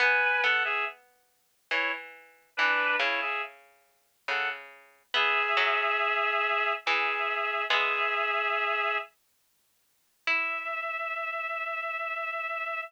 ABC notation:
X:1
M:3/4
L:1/16
Q:1/4=70
K:Emix
V:1 name="Clarinet"
[Bg]2 [Af] [Ge] z4 [Ec] z3 | [DB]2 [Ec] [Ge] z4 [Af] z3 | [Ge]8 [Ge]4 | [Ge]6 z6 |
e12 |]
V:2 name="Harpsichord"
B,2 B,6 E,4 | E,2 C,6 C,4 | B,2 F,6 E,4 | [G,B,]6 z6 |
E12 |]